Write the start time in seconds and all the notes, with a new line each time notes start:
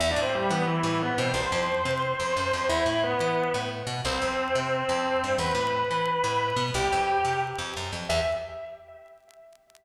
0.00 E2 E4 E5
0.11 D4 D5
0.16 A2
0.22 C4 C5
0.35 G3 G4
0.50 E3 B3 B4
0.67 E3 E4
0.83 A2
1.02 B3 B4
1.18 B2 C4 C5
1.34 C2 C5 C6
1.52 F2
1.85 C3
2.20 F2
2.37 F#2
2.53 F2
2.69 E2 E4 E5
2.86 A2
3.04 B3 B4
3.20 E3
3.54 A2
3.87 B2
4.05 C2 C4 C5
4.22 F2
4.55 C3
4.89 F2
5.24 G2
5.38 E2 B4 B5
5.55 A2
5.91 E3
6.24 A2
6.56 B2
6.74 C2 G4 G5
6.92 F2
7.25 C3
7.58 F2
7.77 F#2
7.92 F2
8.09 E2 E5